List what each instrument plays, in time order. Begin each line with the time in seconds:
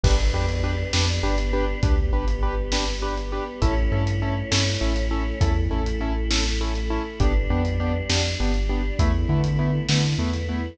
0.03 synth bass 2 G1, choir aahs B3 D4 G4, acoustic grand piano D4 G4 B4, kick, crash
0.33 synth bass 2 F2, acoustic grand piano D4 G4 B4
0.49 closed hi-hat
0.64 acoustic grand piano D4 G4 B4
0.93 synth bass 2 F2, acoustic grand piano D4 G4 B4, snare
1.23 synth bass 2 G1, acoustic grand piano D4 G4 B4
1.38 closed hi-hat
1.53 acoustic grand piano D4 G4 B4
1.83 synth bass 2 D2, choir aahs G3 B3 G4, acoustic grand piano D4 G4 B4, kick, closed hi-hat
2.13 synth bass 2 G1, acoustic grand piano D4 G4 B4
2.28 closed hi-hat
2.43 acoustic grand piano D4 G4 B4
2.72 acoustic grand piano D4 G4 B4, snare
3.02 acoustic grand piano D4 G4 B4
3.17 closed hi-hat
3.32 acoustic grand piano D4 G4 B4
3.62 synth bass 2 A1, choir aahs A3 C#4 E4, acoustic grand piano C#4 E4 A4, kick, closed hi-hat
3.92 synth bass 2 G2, acoustic grand piano C#4 E4 A4
4.07 closed hi-hat
4.22 acoustic grand piano C#4 E4 A4
4.51 synth bass 2 G2, acoustic grand piano C#4 E4 A4, snare
4.81 synth bass 2 A1, acoustic grand piano C#4 E4 A4
4.96 closed hi-hat
5.11 acoustic grand piano C#4 E4 A4
5.41 synth bass 2 E2, choir aahs A3 E4 A4, acoustic grand piano C#4 E4 A4, kick, closed hi-hat
5.71 synth bass 2 A1, acoustic grand piano C#4 E4 A4
5.86 closed hi-hat
6.01 acoustic grand piano C#4 E4 A4
6.30 acoustic grand piano C#4 E4 A4, snare
6.61 acoustic grand piano C#4 E4 A4
6.75 closed hi-hat
6.90 acoustic grand piano C#4 E4 A4
7.20 synth bass 2 G1, choir aahs G3 B3 D4, acoustic grand piano B3 D4 G4, kick, closed hi-hat
7.50 synth bass 2 F2, acoustic grand piano B3 D4 G4
7.65 closed hi-hat
7.80 acoustic grand piano B3 D4 G4
8.09 synth bass 2 F2, choir aahs G3 D4 G4, acoustic grand piano B3 D4 G4, snare
8.40 synth bass 2 G1, acoustic grand piano B3 D4 G4
8.54 closed hi-hat
8.69 acoustic grand piano B3 D4 G4
8.98 synth bass 2 E2, choir aahs A3 B3 E4, acoustic grand piano A3 B3 E4, kick, closed hi-hat
9.29 synth bass 2 D3, acoustic grand piano A3 B3 E4
9.44 closed hi-hat
9.59 acoustic grand piano A3 B3 E4
9.88 synth bass 2 D3, choir aahs E3 A3 E4, acoustic grand piano A3 B3 E4, snare
10.18 synth bass 2 E2, acoustic grand piano A3 B3 E4
10.33 closed hi-hat
10.49 acoustic grand piano A3 B3 E4